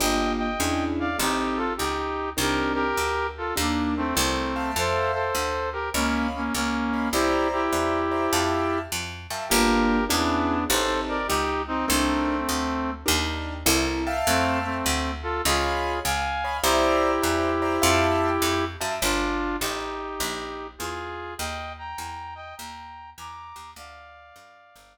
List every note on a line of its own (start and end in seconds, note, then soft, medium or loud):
0.00 0.57 G1 medium
0.00 0.47 A#3 loud
0.00 0.47 D4 loud
0.00 0.47 F4 loud
0.00 0.47 G4 loud
0.00 0.32 D#5 medium
0.00 0.32 G5 medium
0.38 0.84 D#5 medium
0.38 0.84 G5 medium
0.60 1.16 E2 medium
0.60 1.07 C#4 loud
0.60 1.07 D4 loud
0.60 1.07 E4 loud
0.60 1.07 G#4 medium
1.00 1.17 D5 medium
1.00 1.17 F5 medium
1.18 1.75 A1 medium
1.18 1.66 C4 loud
1.18 1.66 D#4 loud
1.18 1.58 D#4 medium
1.18 1.66 G4 loud
1.18 1.58 G4 medium
1.18 1.66 A4 loud
1.57 1.73 F4 medium
1.57 1.73 A4 medium
1.77 2.35 C#2 medium
1.77 2.30 D#4 medium
1.77 2.30 G4 medium
2.37 2.93 C2 medium
2.37 2.84 C4 loud
2.37 2.84 D4 loud
2.37 2.84 D#4 loud
2.37 2.72 G4 medium
2.37 2.84 A#4 loud
2.37 2.72 A#4 medium
2.74 3.27 G4 medium
2.74 3.27 A#4 medium
2.97 3.53 D2 medium
3.37 3.54 F4 medium
3.37 3.54 A4 medium
3.56 4.13 D#2 medium
3.56 3.94 A#3 medium
3.56 4.03 D4 loud
3.56 3.94 D4 medium
3.56 4.03 D#4 medium
3.56 4.03 G4 loud
3.56 4.03 A#4 medium
3.97 4.15 A3 medium
3.97 4.15 C4 medium
4.15 4.73 C2 loud
4.15 4.71 A3 medium
4.15 4.52 C4 loud
4.15 4.71 C4 medium
4.15 4.52 E4 loud
4.15 4.52 A4 loud
4.15 4.52 A#4 loud
4.56 5.23 E5 loud
4.56 5.23 F5 loud
4.56 5.23 G5 loud
4.56 5.23 A5 loud
4.76 5.31 F2 medium
4.76 5.12 A4 medium
4.76 5.12 C5 medium
5.13 5.70 A4 medium
5.13 5.70 C5 medium
5.35 5.90 D2 medium
5.72 5.90 G4 medium
5.72 5.90 A#4 medium
5.94 6.50 C#2 medium
5.94 6.27 A#3 medium
5.94 6.27 C#4 medium
5.94 6.41 C#5 loud
5.94 6.41 D#5 loud
5.94 6.41 F5 loud
5.94 6.41 B5 loud
6.36 6.54 A#3 medium
6.36 6.54 C#4 medium
6.54 7.10 C#2 medium
6.54 7.09 A#3 medium
6.54 7.09 C#4 medium
6.93 7.08 C#5 medium
6.93 7.08 D#5 medium
6.93 7.08 F5 medium
6.93 7.08 B5 medium
7.12 7.68 C2 medium
7.12 7.48 E4 medium
7.12 7.48 G4 loud
7.12 7.61 C5 loud
7.12 7.61 D5 loud
7.12 7.61 E5 loud
7.12 7.61 A#5 loud
7.52 8.79 E4 medium
7.52 8.79 G4 medium
7.72 8.28 E2 medium
7.72 8.00 C5 medium
7.72 8.00 D5 medium
7.72 8.00 E5 medium
7.72 8.00 A#5 medium
8.11 8.26 C5 medium
8.11 8.26 D5 loud
8.11 8.26 E5 medium
8.11 8.26 A#5 medium
8.33 8.88 F2 medium
8.33 8.80 E5 loud
8.33 8.80 F5 loud
8.33 8.80 G5 loud
8.33 8.80 A5 loud
8.92 9.27 F2 medium
9.30 9.49 F#2 medium
9.30 9.45 E5 medium
9.30 9.45 F5 medium
9.30 9.45 G5 medium
9.30 9.45 A5 medium
9.49 10.07 G1 loud
9.49 9.98 A#3 loud
9.49 9.98 D4 loud
9.49 9.98 F4 loud
9.49 10.05 G4 medium
9.49 9.98 G4 loud
9.49 10.05 A#4 medium
10.08 10.66 E2 loud
10.08 10.64 B3 medium
10.08 10.57 C#4 loud
10.08 10.64 D4 medium
10.08 10.57 D4 loud
10.08 10.57 E4 loud
10.08 10.57 G#4 loud
10.69 11.25 A1 loud
10.69 11.17 C4 loud
10.69 11.17 D#4 loud
10.69 11.17 G4 loud
10.69 11.00 A4 medium
10.69 11.17 A4 loud
10.69 11.00 C5 medium
11.08 11.27 A#4 medium
11.08 11.27 D5 medium
11.28 11.85 C#2 medium
11.28 11.62 D#4 medium
11.28 11.62 G4 medium
11.67 11.86 C4 medium
11.67 11.86 D#4 medium
11.87 12.45 C2 loud
11.87 12.91 A3 medium
11.87 12.91 C4 medium
11.87 12.35 C4 loud
11.87 12.35 D4 loud
11.87 12.35 D#4 loud
11.87 12.35 A#4 loud
12.49 13.04 D2 medium
13.06 13.64 D#2 loud
13.06 13.53 D4 loud
13.06 13.53 D#4 loud
13.06 13.53 G4 loud
13.06 13.53 A#4 loud
13.66 14.22 C2 loud
13.66 14.03 C4 loud
13.66 14.03 E4 loud
13.66 14.03 A4 loud
13.66 14.03 A#4 loud
14.07 14.74 E5 loud
14.07 14.74 F5 loud
14.07 14.74 G5 loud
14.07 14.74 A5 loud
14.27 14.82 F2 loud
14.27 14.59 A3 medium
14.27 14.59 C4 medium
14.64 15.11 A3 medium
14.64 15.11 C4 medium
14.86 15.41 D2 medium
15.22 15.42 F4 medium
15.22 15.42 A4 medium
15.45 16.01 C#2 loud
15.45 15.99 F4 medium
15.45 15.99 G#4 medium
15.45 15.93 C#5 loud
15.45 15.93 D#5 loud
15.45 15.93 F5 loud
15.45 15.93 B5 loud
16.04 16.60 C#2 medium
16.04 16.57 F5 medium
16.04 16.57 G#5 medium
16.44 16.59 C#5 loud
16.44 16.59 D#5 loud
16.44 16.59 F5 loud
16.44 16.59 B5 loud
16.62 17.19 C2 loud
16.62 18.65 E4 medium
16.62 18.65 G4 medium
16.62 17.11 C5 loud
16.62 17.11 D5 loud
16.62 17.11 E5 loud
16.62 17.11 A#5 loud
17.22 17.79 E2 medium
17.22 17.50 C5 loud
17.22 17.50 D5 loud
17.22 17.50 E5 loud
17.22 17.50 A#5 medium
17.62 17.76 C5 loud
17.62 17.76 D5 loud
17.62 17.76 E5 loud
17.62 17.76 A#5 loud
17.82 18.38 F2 loud
17.82 18.29 E5 loud
17.82 18.29 F5 loud
17.82 18.29 G5 loud
17.82 18.29 A5 loud
18.42 18.77 F2 medium
18.81 19.00 F#2 medium
18.81 18.95 E5 loud
18.81 18.95 F5 medium
18.81 18.95 G5 loud
18.81 18.95 A5 loud
19.02 19.57 G1 loud
19.02 19.56 D4 medium
19.02 19.56 F4 medium
19.60 20.17 A1 medium
19.60 20.67 D#4 medium
19.60 20.67 G4 medium
20.20 20.75 A#1 loud
20.78 21.35 E2 medium
20.78 21.34 F4 medium
20.78 21.34 G#4 medium
21.38 21.94 D#2 loud
21.38 21.73 D#5 medium
21.38 21.73 G5 medium
21.78 22.34 G5 medium
21.78 22.34 A#5 medium
21.98 22.54 E2 medium
22.35 22.55 D#5 medium
22.35 22.55 G5 medium
22.57 23.14 D#2 medium
22.57 23.10 G5 medium
22.57 23.10 A#5 medium
23.18 23.53 E2 medium
23.18 23.71 A#5 medium
23.18 23.71 D6 medium
23.56 23.74 D#2 medium
23.76 24.32 D2 medium
23.76 24.98 D5 medium
23.76 24.98 F5 loud
24.36 24.73 F#2 medium
24.75 24.98 G1 loud